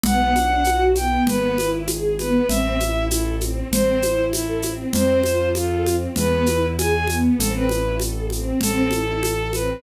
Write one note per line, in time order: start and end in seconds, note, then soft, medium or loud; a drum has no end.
0.03 1.17 B1 loud
0.03 0.32 B3 loud
0.03 0.83 F#5 medium
0.03 low conga loud
0.03 shaker medium
0.34 0.61 D4 medium
0.34 high conga medium
0.34 shaker medium
0.64 0.92 F#4 loud
0.64 high conga medium
0.64 shaker medium
0.95 1.24 B3 medium
0.95 1.23 G5 medium
0.95 high conga medium
0.95 shaker medium
1.27 2.40 G#1 loud
1.27 1.55 B3 loud
1.27 1.70 B4 medium
1.27 low conga loud
1.27 shaker medium
1.58 1.86 E4 loud
1.58 high conga medium
1.58 shaker medium
1.87 2.16 G#4 medium
1.87 high conga medium
1.87 shaker medium
2.19 2.46 B3 medium
2.19 2.48 B4 medium
2.19 high conga medium
2.19 shaker medium
2.48 3.62 A1 loud
2.48 2.76 C4 loud
2.48 3.05 E5 loud
2.48 low conga loud
2.48 shaker medium
2.80 3.08 E4 medium
2.80 high conga medium
2.80 shaker medium
3.10 3.35 E4 medium
3.10 3.40 A4 medium
3.10 high conga medium
3.10 shaker loud
3.40 3.68 C4 medium
3.40 high conga medium
3.40 shaker medium
3.71 4.84 A1 loud
3.71 4.00 C4 loud
3.71 4.25 C5 medium
3.71 low conga loud
3.71 shaker medium
4.02 4.31 E4 loud
4.02 high conga medium
4.02 shaker medium
4.33 4.72 E4 medium
4.33 4.60 A4 medium
4.33 high conga medium
4.33 shaker medium
4.62 4.91 C4 medium
4.62 high conga medium
4.62 shaker medium
4.93 6.07 F2 loud
4.93 5.21 C4 loud
4.93 5.49 C5 loud
4.93 low conga loud
4.93 shaker medium
5.23 5.51 F4 medium
5.23 high conga medium
5.23 shaker medium
5.55 5.96 F4 medium
5.55 5.83 A4 medium
5.55 high conga medium
5.55 shaker medium
5.86 6.14 C4 medium
5.86 high conga medium
5.86 shaker medium
6.16 7.29 E2 loud
6.16 6.46 B3 loud
6.16 6.66 B4 loud
6.16 low conga loud
6.16 shaker medium
6.46 6.74 E4 medium
6.46 high conga medium
6.46 shaker medium
6.78 7.06 G#4 loud
6.78 7.15 G#5 medium
6.78 high conga loud
6.78 shaker medium
7.07 7.37 B3 medium
7.07 high conga medium
7.07 shaker medium
7.38 8.52 A1 loud
7.38 7.66 C4 loud
7.38 7.53 A4 medium
7.38 low conga loud
7.38 shaker loud
7.55 7.95 B4 medium
7.68 7.96 E4 medium
7.68 high conga medium
7.68 shaker medium
7.99 8.26 A4 medium
7.99 high conga medium
7.99 shaker medium
8.30 8.59 C4 medium
8.30 high conga medium
8.30 shaker medium
8.61 9.74 A1 loud
8.61 8.89 C4 loud
8.61 9.51 A4 loud
8.61 low conga loud
8.61 shaker loud
8.91 9.19 E4 medium
8.91 high conga medium
8.91 shaker medium
9.23 9.51 A4 medium
9.23 high conga medium
9.23 shaker medium
9.53 9.82 C4 medium
9.53 9.81 B4 medium
9.53 high conga medium
9.53 shaker medium